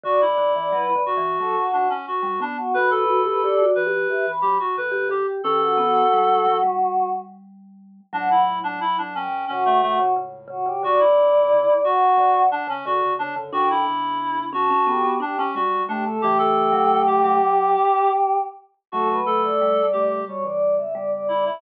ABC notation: X:1
M:4/4
L:1/16
Q:1/4=89
K:D
V:1 name="Choir Aahs"
d d2 d B2 z2 A F2 z4 F | B B2 B d2 z2 e b2 z4 g | G F F8 z6 | f2 z4 g2 F2 F2 z2 F G |
d6 f4 z6 | g2 z4 a2 G2 G2 z2 G A | G14 z2 | A B2 d5 c d2 e d d d e |]
V:2 name="Clarinet"
F E5 F4 D C F2 D z | B A5 B4 G F B2 G z | A8 z8 | D E2 D E D C2 C A, A, z5 |
F E5 F4 D C F2 D z | F E5 F4 D C F2 D z | G A4 G G6 z4 | F2 A4 G2 z6 E E |]
V:3 name="Vibraphone"
D,2 D, E, (3F,2 D,2 E,2 F, z4 G, B,2 | F2 F G (3G2 F2 G2 G z4 G G2 | C2 B,2 G,2 F, G,9 | F,8 C,3 C, C,2 C, C, |
D,8 D,3 C, D,2 C, C, | D6 C C B, B, D C G,2 A,2 | E,3 F,3 F,4 z6 | F,4 G,8 G,4 |]
V:4 name="Ocarina"
[A,,,F,,]4 z2 [B,,,G,,]2 z [B,,,G,,] [C,,A,,] z [A,,,F,,]3 z | [F,,D,]4 z2 [G,,E,]2 z [G,,E,] [A,,F,] z [F,,D,]3 z | [G,,E,]4 [C,,A,,]4 z8 | [C,,A,,]4 z [B,,,G,,] [A,,,F,,]2 [A,,,F,,]2 [A,,,F,,]2 [C,,A,,]4 |
[C,,A,,] [B,,,G,,]2 [C,,A,,] [E,,C,] z7 [F,,D,] [E,,C,]2 [F,,D,] | [F,,D,]2 [E,,C,]6 [F,,D,] z3 [B,,G,]2 [C,A,]2 | [C,A,]8 z8 | [C,A,]2 [C,A,]4 [C,A,]2 [B,,G,] [G,,E,] [G,,E,] [E,,C,]5 |]